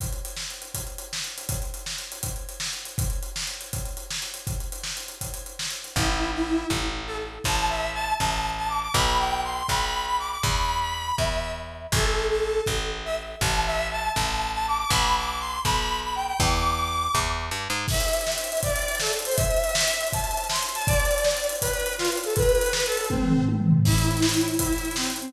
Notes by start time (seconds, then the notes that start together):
0.00 kick, closed hi-hat
0.13 closed hi-hat
0.25 closed hi-hat
0.37 snare
0.50 closed hi-hat
0.62 closed hi-hat
0.74 kick, closed hi-hat
0.87 closed hi-hat
0.98 closed hi-hat
1.13 snare
1.24 closed hi-hat
1.38 closed hi-hat
1.49 kick, closed hi-hat
1.62 closed hi-hat
1.74 closed hi-hat
1.86 snare
1.98 closed hi-hat
2.12 closed hi-hat
2.23 kick, closed hi-hat
2.36 closed hi-hat
2.49 closed hi-hat
2.60 snare
2.73 closed hi-hat
2.85 closed hi-hat
2.98 kick, closed hi-hat
3.10 closed hi-hat
3.23 closed hi-hat
3.36 snare
3.47 closed hi-hat
3.61 closed hi-hat
3.73 kick, closed hi-hat
3.85 closed hi-hat
3.97 closed hi-hat
4.10 snare
4.22 closed hi-hat
4.34 closed hi-hat
4.47 kick, closed hi-hat
4.60 closed hi-hat
4.72 closed hi-hat
4.83 snare
4.97 closed hi-hat
5.08 closed hi-hat
5.21 kick, closed hi-hat
5.34 closed hi-hat
5.46 closed hi-hat
5.59 snare
5.70 closed hi-hat
5.84 closed hi-hat
5.96 A1 E4, kick
6.34 E4
6.70 A1, kick
7.06 A4
7.44 A1 A5, kick
7.70 E5
7.94 A5
8.19 A1 A5, kick
8.57 A5
8.68 D6
8.82 D6
8.93 B1 B5, kick
9.19 G5
9.43 C6
9.68 B1 B5, kick
10.07 B5
10.19 D6
10.30 D6
10.43 E2 B5, kick
10.81 B5
11.18 E2 E5, kick
11.92 A1 A4, kick
12.30 A4
12.66 A1, kick
13.05 E5
13.41 A1 A5, kick
13.66 E5
13.91 A5
14.16 A1 A5, kick
14.54 A5
14.67 D6
14.78 D6
14.90 B1 B5, kick
15.16 D6
15.40 C6
15.65 B1 B5, kick
16.03 B5
16.15 G5
16.27 G5
16.40 E2 D6, kick
17.15 E2, kick
17.51 G2
17.70 G#2
17.88 E5, kick, crash
17.94 closed hi-hat
18.00 closed hi-hat
18.08 closed hi-hat
18.13 closed hi-hat
18.21 closed hi-hat
18.27 snare
18.32 closed hi-hat
18.38 closed hi-hat
18.44 closed hi-hat
18.52 closed hi-hat
18.57 closed hi-hat
18.63 D5, kick, closed hi-hat
18.70 closed hi-hat
18.76 closed hi-hat
18.82 closed hi-hat
18.88 closed hi-hat
18.95 closed hi-hat
19.00 A4, snare
19.07 closed hi-hat
19.13 closed hi-hat
19.19 closed hi-hat
19.25 C5, closed hi-hat
19.31 open hi-hat
19.36 E5, kick, closed hi-hat
19.45 closed hi-hat
19.51 closed hi-hat
19.57 closed hi-hat
19.64 closed hi-hat
19.69 closed hi-hat
19.75 snare
19.81 closed hi-hat
19.88 closed hi-hat
19.93 closed hi-hat
20.01 closed hi-hat
20.07 closed hi-hat
20.13 A5, kick, closed hi-hat
20.19 closed hi-hat
20.24 closed hi-hat
20.31 closed hi-hat
20.37 closed hi-hat
20.44 closed hi-hat
20.50 C6, snare
20.56 closed hi-hat
20.63 closed hi-hat
20.69 closed hi-hat
20.75 A5, closed hi-hat
20.82 closed hi-hat
20.87 D5, kick, closed hi-hat
20.93 closed hi-hat
21.00 closed hi-hat
21.05 closed hi-hat
21.11 closed hi-hat
21.18 closed hi-hat
21.24 snare
21.31 closed hi-hat
21.37 closed hi-hat
21.44 closed hi-hat
21.49 closed hi-hat
21.55 closed hi-hat
21.61 B4, kick, closed hi-hat
21.67 closed hi-hat
21.73 closed hi-hat
21.80 closed hi-hat
21.86 closed hi-hat
21.93 closed hi-hat
21.98 F4, snare
22.05 closed hi-hat
22.12 closed hi-hat
22.17 closed hi-hat
22.24 A4, closed hi-hat
22.30 closed hi-hat
22.36 B4, kick, closed hi-hat
22.42 closed hi-hat
22.49 closed hi-hat
22.55 closed hi-hat
22.61 closed hi-hat
22.66 closed hi-hat
22.73 B4, snare
22.80 closed hi-hat
22.86 A4, closed hi-hat
22.92 closed hi-hat
22.97 closed hi-hat
23.04 closed hi-hat
23.10 C4, kick, high tom
23.22 mid tom
23.36 floor tom
23.49 high tom
23.60 mid tom
23.72 floor tom
23.85 E4, kick, crash
23.92 closed hi-hat
23.98 closed hi-hat
24.05 closed hi-hat
24.11 closed hi-hat
24.17 closed hi-hat
24.22 snare
24.29 closed hi-hat
24.34 closed hi-hat
24.41 closed hi-hat
24.48 closed hi-hat
24.54 closed hi-hat
24.59 E4, kick, closed hi-hat
24.66 closed hi-hat
24.73 closed hi-hat
24.78 closed hi-hat
24.85 closed hi-hat
24.91 closed hi-hat
24.96 C4, snare
25.03 closed hi-hat
25.10 closed hi-hat
25.16 closed hi-hat
25.21 C4, closed hi-hat
25.28 closed hi-hat